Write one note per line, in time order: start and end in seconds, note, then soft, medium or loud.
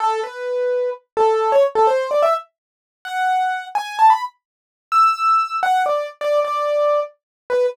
0.00 0.20 A4 loud
0.23 0.90 B4 medium
1.17 1.51 A4 loud
1.52 1.63 C#5 loud
1.75 1.87 A4 loud
1.87 2.07 C5 loud
2.11 2.22 D5 medium
2.22 2.34 E5 loud
3.05 3.65 F#5 loud
3.75 3.97 G#5 loud
3.99 4.10 A5 medium
4.10 4.21 B5 medium
4.92 5.56 E6 medium
5.63 5.82 F#5 loud
5.86 6.07 D5 medium
6.21 6.40 D5 loud
6.45 7.00 D5 medium
7.50 7.66 B4 loud